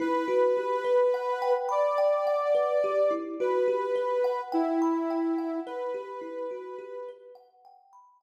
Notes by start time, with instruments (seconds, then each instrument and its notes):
0.00 kalimba E4, ocarina B4
0.28 kalimba F#4
0.57 kalimba G4
0.84 kalimba B4
1.14 kalimba F#5
1.42 kalimba G5
1.69 ocarina D5, kalimba B5
1.98 kalimba G5
2.27 kalimba F#5
2.55 kalimba B4
2.84 kalimba G4
3.11 kalimba E4
3.40 kalimba F#4, ocarina B4
3.68 kalimba G4
3.96 kalimba B4
4.24 kalimba F#5
4.52 ocarina E4, kalimba G5
4.82 kalimba B5
5.10 kalimba G5
5.38 kalimba F#5
5.66 ocarina B4, kalimba B4
5.94 kalimba G4
6.21 kalimba E4
6.51 kalimba F#4
6.79 kalimba G4
7.08 kalimba B4
7.35 kalimba F#5
7.65 kalimba G5
7.93 kalimba B5
8.21 kalimba G5